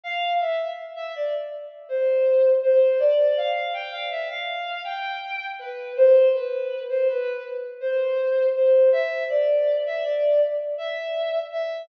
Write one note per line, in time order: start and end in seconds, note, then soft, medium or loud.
0.04 0.34 F5 loud
0.40 0.71 E5 medium
0.96 1.13 E5 loud
1.16 1.33 D5 loud
1.89 2.49 C5 loud
2.63 2.98 C5 loud
2.99 3.33 D5 loud
3.37 3.71 F5 loud
3.74 3.91 G5 loud
3.91 4.09 F5 loud
4.11 4.28 E5 loud
4.30 4.82 F5 loud
4.84 5.45 G5 loud
5.59 5.93 B4 loud
5.97 6.27 C5 loud
6.34 6.81 B4 loud
6.89 7.07 C5 loud
7.08 7.43 B4 loud
7.80 8.47 C5 loud
8.55 8.89 C5 medium
8.92 9.24 E5 loud
9.29 9.75 D5 loud
9.86 10.04 E5 loud
10.04 10.40 D5 loud
10.78 11.39 E5 loud
11.52 11.82 E5 loud